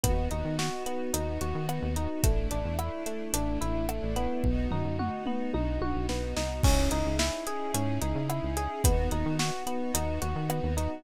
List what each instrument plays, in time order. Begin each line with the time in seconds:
0.04 synth bass 1 D#2, electric piano 1 B3, string ensemble 1 B3 D#4 F#4, kick, closed hi-hat
0.31 synth bass 1 D#2, electric piano 1 D#4, closed hi-hat
0.45 synth bass 1 D#3
0.59 electric piano 1 F#4, snare
0.86 electric piano 1 B3, closed hi-hat
1.14 synth bass 1 D#2, electric piano 1 D#4, closed hi-hat
1.41 synth bass 1 D#2, electric piano 1 F#4, closed hi-hat
1.55 synth bass 1 D#3
1.69 electric piano 1 B3, cross-stick
1.82 synth bass 1 D#2
1.96 electric piano 1 D#4, closed hi-hat
2.23 synth bass 1 A1, string ensemble 1 A3 D4 E4, electric piano 1 A3, kick, closed hi-hat
2.51 synth bass 1 A1, electric piano 1 D4, closed hi-hat
2.65 synth bass 1 E2
2.79 electric piano 1 E4, cross-stick
3.06 electric piano 1 A3, closed hi-hat
3.33 synth bass 1 A1, electric piano 1 D4, closed hi-hat
3.61 synth bass 1 A1, electric piano 1 E4, closed hi-hat
3.75 synth bass 1 A1
3.89 electric piano 1 A3, cross-stick
4.03 synth bass 1 A1
4.16 electric piano 1 B3, closed hi-hat
4.44 synth bass 1 B1, string ensemble 1 B3 D#4 F#4, kick
4.71 synth bass 1 F#2, electric piano 1 D#4, floor tom
4.85 synth bass 1 F#2
4.99 electric piano 1 F#4, mid tom
5.26 electric piano 1 B3, mid tom
5.54 synth bass 1 B1, electric piano 1 D#4, high tom
5.81 synth bass 1 B1, electric piano 1 F#4, high tom
5.95 synth bass 1 B1
6.09 synth bass 1 B1, electric piano 1 B3, snare
6.36 synth bass 1 C2, electric piano 1 D#4, snare
6.63 synth bass 1 C#2, string ensemble 1 C#4 D#4 E4 G#4, electric piano 1 C#4, kick, crash
6.91 synth bass 1 C#2, electric piano 1 D#4, closed hi-hat
7.06 synth bass 1 C#2
7.19 electric piano 1 E4, snare
7.47 electric piano 1 G#4, closed hi-hat
7.74 synth bass 1 G#2, electric piano 1 C#4, closed hi-hat
8.01 synth bass 1 C#2, electric piano 1 D#4, closed hi-hat
8.15 synth bass 1 C#3
8.29 electric piano 1 E4, cross-stick
8.43 synth bass 1 C#2
8.57 electric piano 1 G#4, closed hi-hat
8.84 synth bass 1 D#2, string ensemble 1 B3 D#4 F#4, electric piano 1 B3, kick, closed hi-hat
9.11 synth bass 1 D#2, electric piano 1 D#4, closed hi-hat
9.26 synth bass 1 D#3
9.39 electric piano 1 F#4, snare
9.67 electric piano 1 B3, closed hi-hat
9.94 synth bass 1 D#2, electric piano 1 D#4, closed hi-hat
10.22 synth bass 1 D#2, electric piano 1 F#4, closed hi-hat
10.36 synth bass 1 D#3
10.49 electric piano 1 B3, cross-stick
10.63 synth bass 1 D#2
10.77 electric piano 1 D#4, closed hi-hat